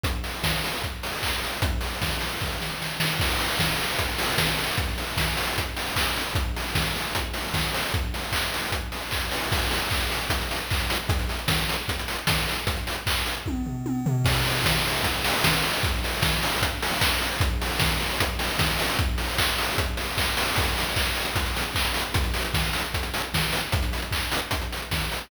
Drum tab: CC |----------------|----------------|x---------------|----------------|
HH |x-o---o-x-o---o-|x-o---o---------|--o---o-x-o---o-|x-o---o-x-o---o-|
CP |------------x---|----------------|----------------|------------x---|
SD |----o-----------|----o---o-o-o-o-|----o-------o---|----o-----------|
T1 |----------------|----------------|----------------|----------------|
FT |----------------|----------------|----------------|----------------|
BD |o---o---o---o---|o---o---o-------|o---o---o---o---|o---o---o---o---|

CC |----------------|----------------|x---------------|----------------|
HH |x-o---o-x-o---o-|x-o---o-x-o---o-|-xox-xoxxxox-xox|xxox-xoxxxox-xox|
CP |----------------|----x-------x---|----x-------x---|----------------|
SD |----o-------o---|----------------|----------------|----o-------o---|
T1 |----------------|----------------|----------------|----------------|
FT |----------------|----------------|----------------|----------------|
BD |o---o---o---o---|o---o---o---o---|o---o---o---o---|o---o---o---o---|

CC |----------------|x---------------|----------------|----------------|
HH |xxox-xox--------|--o---o-x-o---o-|x-o---o-x-o---o-|x-o---o-x-o---o-|
CP |----x-----------|----------------|------------x---|----------------|
SD |----------------|----o-------o---|----o-----------|----o-------o---|
T1 |--------o---o---|----------------|----------------|----------------|
FT |----------o---o-|----------------|----------------|----------------|
BD |o---o---o-------|o---o---o---o---|o---o---o---o---|o---o---o---o---|

CC |----------------|x---------------|----------------|----------------|
HH |x-o---o-x-o---o-|-xox-xoxxxox-xox|xxox-xoxxxox-xox|xxox-xoxxxox-xox|
CP |----x-------x---|----x-------x---|----------------|----x-----------|
SD |----------------|----------------|----o-------o---|------------o---|
T1 |----------------|----------------|----------------|----------------|
FT |----------------|----------------|----------------|----------------|
BD |o---o---o---o---|o---o---o---o---|o---o---o---o---|o---o---o---o---|